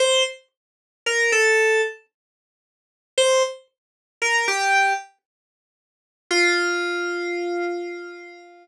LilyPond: \new Staff { \time 3/4 \key f \mixolydian \tempo 4 = 57 c''16 r8. bes'16 a'8 r4 r16 | c''16 r8. bes'16 g'8 r4 r16 | f'2~ f'8 r8 | }